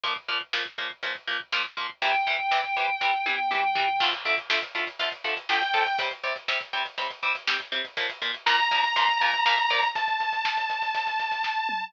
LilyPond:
<<
  \new Staff \with { instrumentName = "Lead 2 (sawtooth)" } { \time 4/4 \key d \minor \tempo 4 = 121 r1 | r1 | r2. g''4 | r1 |
r4 bes''2. | a''1 | }
  \new Staff \with { instrumentName = "Distortion Guitar" } { \time 4/4 \key d \minor r1 | g''1 | r1 | r1 |
r1 | r1 | }
  \new Staff \with { instrumentName = "Overdriven Guitar" } { \time 4/4 \key d \minor <bes, f bes>8 <bes, f bes>8 <bes, f bes>8 <bes, f bes>8 <bes, f bes>8 <bes, f bes>8 <bes, f bes>8 <bes, f bes>8 | <c e g>8 <c e g>8 <c e g>8 <c e g>8 <c e g>8 <c e g>8 <c e g>8 <c e g>8 | <d f a>8 <d f a>8 <d f a>8 <d f a>8 <d f a>8 <d f a>8 <d f a>8 <d f a>8 | <c g c'>8 <c g c'>8 <c g c'>8 <c g c'>8 <c g c'>8 <c g c'>8 <c g c'>8 <c g c'>8 |
<bes, f bes>8 <bes, f bes>8 <bes, f bes>8 <bes, f bes>8 <bes, f bes>8 <bes, f bes>8 <bes, f bes>8 <bes, f bes>8 | r1 | }
  \new DrumStaff \with { instrumentName = "Drums" } \drummode { \time 4/4 <hh bd>16 bd16 <hh bd>16 bd16 <bd sn>16 bd16 <hh bd>16 bd16 <hh bd>16 bd16 <hh bd>16 bd16 <bd sn>16 bd16 <hh bd>16 bd16 | <hh bd>16 bd16 <hh bd>16 bd16 <bd sn>16 bd16 <hh bd>16 bd16 <bd sn>8 tommh8 toml8 tomfh8 | <cymc bd>16 <hh bd>16 <hh bd>16 <hh bd>16 <bd sn>16 <hh bd>16 <hh bd>16 <hh bd>16 <hh bd>16 <hh bd>16 <hh bd>16 <hh bd>16 <bd sn>16 <hh bd>16 <hh bd>16 <hh bd>16 | <hh bd>16 <hh bd>16 <hh bd>16 <hh bd>16 <bd sn>16 <hh bd>16 <hh bd>16 <hh bd>16 <hh bd>16 <hh bd>16 <hh bd>16 <hh bd>16 <bd sn>16 <hh bd>16 <hh bd>16 <hh bd>16 |
<hh bd>16 <hh bd>16 <hh bd>16 <hh bd>16 <bd sn>16 <hh bd>16 <hh bd>16 <hh bd>16 <hh bd>16 <hh bd>16 <hh bd>16 <hh bd>16 <bd sn>16 <hh bd>16 <hh bd>16 <hh bd>16 | <hh bd>16 <hh bd>16 <hh bd>16 <hh bd>16 <bd sn>16 <hh bd>16 <hh bd>16 <hh bd>16 <hh bd>16 <hh bd>16 <hh bd>16 <hh bd>16 <bd sn>8 toml8 | }
>>